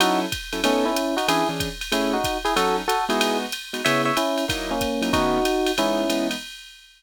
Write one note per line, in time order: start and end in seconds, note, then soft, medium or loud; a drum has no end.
0.00 0.26 F#3 loud
0.00 0.26 C#4 medium
0.00 0.20 D#4 medium
0.00 0.26 E4 loud
0.00 0.20 F#4 loud
0.00 0.26 A4 loud
0.00 ride loud
0.32 kick medium
0.32 hi-hat pedal medium
0.32 ride medium
0.53 0.60 F#3 medium
0.53 0.60 C#4 medium
0.53 0.60 E4 medium
0.53 0.60 A4 medium
0.53 ride medium
0.64 0.85 A3 medium
0.64 0.89 B3 loud
0.64 0.89 C#4 loud
0.64 0.85 C#4 medium
0.64 0.89 D#4 loud
0.64 0.89 A4 loud
0.64 ride loud
0.85 1.15 C#4 medium
0.85 1.15 E4 medium
0.96 hi-hat pedal medium
0.96 ride medium
1.17 1.27 D#4 medium
1.17 1.27 F#4 medium
1.17 ride medium
1.28 1.43 E3 loud
1.28 1.43 C#4 loud
1.28 1.43 D4 loud
1.28 1.48 E4 medium
1.28 1.43 G#4 loud
1.28 1.48 G#4 loud
1.28 ride loud
1.49 1.69 E3 medium
1.49 1.69 C#4 medium
1.49 1.69 D4 medium
1.49 1.69 G#4 medium
1.60 kick medium
1.60 hi-hat pedal medium
1.60 ride medium
1.81 ride medium
1.92 2.17 A3 loud
1.92 2.17 C#4 loud
1.92 2.12 C#4 medium
1.92 2.17 E4 loud
1.92 2.12 E4 medium
1.92 2.17 G#4 loud
1.92 ride loud
2.13 2.38 D#4 medium
2.13 2.38 F#4 medium
2.24 kick medium
2.24 hi-hat pedal medium
2.24 ride medium
2.45 2.54 E4 medium
2.45 2.54 G#4 loud
2.45 ride medium
2.56 2.81 F#3 loud
2.56 2.81 C#4 loud
2.56 2.81 D#4 loud
2.56 2.76 F#4 medium
2.56 2.81 A4 loud
2.56 2.76 A4 loud
2.56 ride loud
2.88 3.05 F#4 medium
2.88 3.05 A4 loud
2.88 hi-hat pedal medium
2.88 ride medium
3.09 3.45 G#3 loud
3.09 3.45 B3 loud
3.09 3.45 D#4 loud
3.09 3.38 E4 medium
3.09 3.45 F#4 loud
3.09 3.38 G#4 medium
3.09 ride medium
3.21 ride loud
3.52 hi-hat pedal medium
3.52 ride medium
3.73 3.81 G#3 medium
3.73 3.81 B3 medium
3.73 3.81 D#4 medium
3.73 3.81 F#4 medium
3.73 ride medium
3.85 4.11 C#3 loud
3.85 4.11 B3 loud
3.85 4.11 E4 loud
3.85 4.11 G#4 loud
3.85 4.02 C#5 medium
3.85 4.02 E5 loud
3.85 ride loud
4.05 4.16 C#5 medium
4.05 4.16 E5 medium
4.17 4.45 C#4 medium
4.17 4.45 E4 medium
4.17 hi-hat pedal medium
4.17 ride medium
4.38 ride medium
4.48 4.74 F#3 loud
4.48 4.74 A#3 loud
4.48 4.74 D#4 loud
4.48 4.74 E4 loud
4.48 kick medium
4.48 ride loud
4.71 5.13 A#3 medium
4.71 5.13 C#4 medium
4.81 kick medium
4.81 hi-hat pedal medium
4.81 ride medium
5.02 5.09 F#3 loud
5.02 5.09 A#3 medium
5.02 5.09 D#4 medium
5.02 5.09 E4 medium
5.02 ride medium
5.13 5.39 D#3 loud
5.13 5.39 A3 loud
5.13 5.39 B3 loud
5.13 5.39 C#4 loud
5.13 5.72 D#4 medium
5.13 5.72 F#4 loud
5.13 kick medium
5.13 ride medium
5.45 hi-hat pedal medium
5.45 ride medium
5.66 ride medium
5.78 6.04 E3 medium
5.78 6.04 G#3 medium
5.78 6.04 B3 loud
5.78 6.27 C#4 medium
5.78 6.04 D#4 medium
5.78 6.27 E4 loud
5.78 ride loud
6.10 6.35 E3 medium
6.10 6.35 G#3 medium
6.10 6.35 B3 loud
6.10 6.35 D#4 medium
6.10 hi-hat pedal medium
6.10 ride medium
6.31 ride medium